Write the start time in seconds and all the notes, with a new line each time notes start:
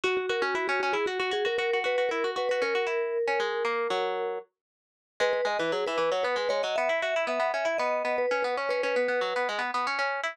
0.04 F#4
0.17 F#4
0.29 F#4 A#4
0.42 C#4 F#4
0.55 E4 F#4
0.68 C#4 F#4
0.80 C#4 F#4
0.93 E4 G#4
1.06 F#4
1.20 F#4
1.31 F#4 G#4
1.45 F#4 A#4
1.58 F#4 A#4
1.73 F#4
1.84 F#4 B4
1.98 F#4
2.09 E4 A#4
2.24 F#4
2.36 F#4 B4
2.49 F#4 B4
2.62 C#4 A#4
2.75 F#4
2.87 E4
3.27 C#4
3.40 G#3
3.65 A#3
3.90 F#3
5.20 G#3 B4
5.33 B4
5.45 G#3 D#5
5.59 E3 B4
5.72 F#3 G#4
5.86 E3 B4
5.98 E3 B4
6.12 F#3 C#5
6.23 B3 B4
6.36 G#3 B4
6.49 G#3 C#5
6.63 F#3 D#5
6.76 B3 E5
6.89 E4
7.02 F#4 E5
7.16 E4
7.27 B3 E5
7.40 B3
7.54 C#4 E5
7.65 E4 E5
7.78 B3 D#5
8.05 B3
8.18 B4
8.31 C#4 B4
8.42 B3 B4
8.57 C#4 C#5
8.69 C#4 B4
8.83 C#4 B4
8.96 B3
9.08 B3
9.21 F#3
9.36 B3
9.49 G#3
9.59 B3
9.74 B3
9.87 C#4
9.99 C#4
10.23 E4